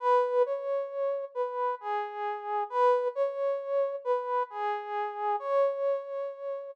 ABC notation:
X:1
M:4/4
L:1/8
Q:"Swing" 1/4=89
K:C#m
V:1 name="Brass Section"
B c3 B G3 | B c3 B G3 | c4 z4 |]